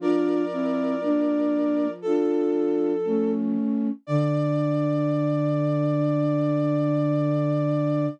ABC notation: X:1
M:4/4
L:1/8
Q:1/4=59
K:Dm
V:1 name="Flute"
[Bd]4 A3 z | d8 |]
V:2 name="Flute"
[DF] [CE] [B,D]2 [DF]2 [A,^C]2 | D8 |]
V:3 name="Flute" clef=bass
F,8 | D,8 |]